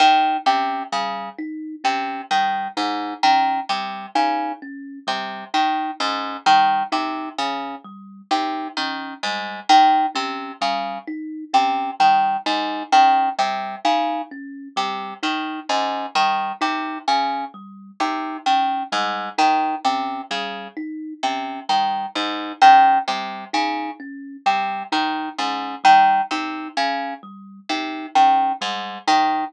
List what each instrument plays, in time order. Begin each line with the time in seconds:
0.00 orchestral harp D#3, kalimba D#4
0.46 orchestral harp C3, kalimba C#4
0.92 orchestral harp C#3, kalimba G3
1.38 kalimba D#4
1.84 orchestral harp C3, kalimba C#4
2.31 orchestral harp D#3, kalimba G3
2.77 orchestral harp G#2, kalimba D#4
3.23 orchestral harp D#3, kalimba C#4
3.69 orchestral harp C3, kalimba G3
4.15 orchestral harp C#3, kalimba D#4
4.62 kalimba C#4
5.07 orchestral harp C3, kalimba G3
5.54 orchestral harp D#3, kalimba D#4
6.00 orchestral harp G#2, kalimba C#4
6.46 orchestral harp D#3, kalimba G3
6.92 orchestral harp C3, kalimba D#4
7.38 orchestral harp C#3, kalimba C#4
7.84 kalimba G3
8.31 orchestral harp C3, kalimba D#4
8.77 orchestral harp D#3, kalimba C#4
9.23 orchestral harp G#2, kalimba G3
9.69 orchestral harp D#3, kalimba D#4
10.15 orchestral harp C3, kalimba C#4
10.61 orchestral harp C#3, kalimba G3
11.08 kalimba D#4
11.53 orchestral harp C3, kalimba C#4
12.00 orchestral harp D#3, kalimba G3
12.46 orchestral harp G#2, kalimba D#4
12.92 orchestral harp D#3, kalimba C#4
13.38 orchestral harp C3, kalimba G3
13.85 orchestral harp C#3, kalimba D#4
14.31 kalimba C#4
14.76 orchestral harp C3, kalimba G3
15.23 orchestral harp D#3, kalimba D#4
15.69 orchestral harp G#2, kalimba C#4
16.15 orchestral harp D#3, kalimba G3
16.61 orchestral harp C3, kalimba D#4
17.08 orchestral harp C#3, kalimba C#4
17.54 kalimba G3
18.00 orchestral harp C3, kalimba D#4
18.46 orchestral harp D#3, kalimba C#4
18.92 orchestral harp G#2, kalimba G3
19.38 orchestral harp D#3, kalimba D#4
19.85 orchestral harp C3, kalimba C#4
20.31 orchestral harp C#3, kalimba G3
20.77 kalimba D#4
21.23 orchestral harp C3, kalimba C#4
21.69 orchestral harp D#3, kalimba G3
22.15 orchestral harp G#2, kalimba D#4
22.62 orchestral harp D#3, kalimba C#4
23.08 orchestral harp C3, kalimba G3
23.53 orchestral harp C#3, kalimba D#4
24.00 kalimba C#4
24.46 orchestral harp C3, kalimba G3
24.92 orchestral harp D#3, kalimba D#4
25.38 orchestral harp G#2, kalimba C#4
25.84 orchestral harp D#3, kalimba G3
26.31 orchestral harp C3, kalimba D#4
26.77 orchestral harp C#3, kalimba C#4
27.23 kalimba G3
27.69 orchestral harp C3, kalimba D#4
28.15 orchestral harp D#3, kalimba C#4
28.61 orchestral harp G#2, kalimba G3
29.08 orchestral harp D#3, kalimba D#4